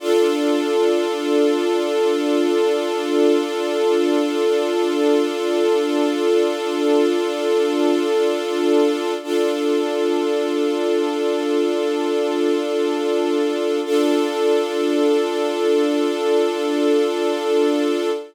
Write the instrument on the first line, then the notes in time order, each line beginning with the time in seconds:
string ensemble 1
0.00 D4 F4 A4
9.23 D4 F4 A4
13.85 D4 F4 A4